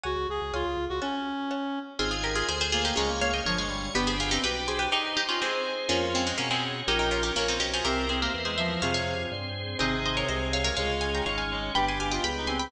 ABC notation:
X:1
M:2/2
L:1/8
Q:1/2=123
K:F#m
V:1 name="Harpsichord"
z8 | z8 | [K:Fm] [FA] [FA] [GB] [FA] [Ac] [Ac] [FA] [EG] | [Bd]2 [df] [eg] [Bd] [df]3 |
[G=B] [Ac] [FA] [EG] [GB]2 [Ac] [GB] | [EG]2 [EG] [DF] [A,C]3 z | [B,D]2 [A,C] [A,C] [B,D] [A,C]3 | [EG] [EG] [DF] [EG] [B,D] [CE] [EG] [FA] |
[GB]2 [Ac] [GB] z [Ac] [c=e]2 | [df] [df]5 z2 | [ce]2 [ce] [Bd] [ce]2 [df] [Bd] | [df]2 [fa] [gb] [df] [fa]3 |
[g=b] [ac'] [fa] [eg] [gb]2 [ac'] [gb] |]
V:2 name="Clarinet"
F2 G2 ^E3 F | C7 z | [K:Fm] z6 B,2 | A, B, B, z F, A, G,2 |
=B,2 z C G4 | E2 z F c4 | F F2 z5 | B3 B B c z c |
C2 C B, z A, F,2 | C,3 z5 | C,8 | A,6 A,2 |
G2 G F z E C2 |]
V:3 name="Harpsichord"
[cfg]4 [c^eg]4 | [cfa]4 [cfa]4 | [K:Fm] [CEA]8 | [DFA]8 |
[=B,=DG]8 | z8 | [DFA]8 | [DGB]8 |
[C=EGB]8 | [CFA]8 | [CEA]8 | z8 |
[=B=dg]8 |]
V:4 name="Drawbar Organ" clef=bass
C,, C,, C,, C,, C,, C,, C,, C,, | z8 | [K:Fm] A,,,4 =D,,4 | D,,4 G,,,4 |
G,,,4 =B,,,4 | z8 | F,,4 =B,,4 | B,,,4 B,,,2 =B,,,2 |
C,,4 =E,,4 | F,,4 G,,4 | A,,,4 C,,4 | D,,4 A,,,4 |
G,,,4 D,,4 |]
V:5 name="Drawbar Organ"
z8 | z8 | [K:Fm] [cea]4 [Aca]4 | [dfa]4 [dad']4 |
[=DG=B]8 | [EGc]4 [EAc]4 | [DFA]4 [DAd]4 | [DGB]4 [DBd]4 |
[C=EGB]4 [CEBc]4 | [CFA]4 [CAc]4 | [CEA]4 [A,CA]4 | [DFA]4 [DAd]4 |
[=B,=DG]4 [G,B,G]4 |]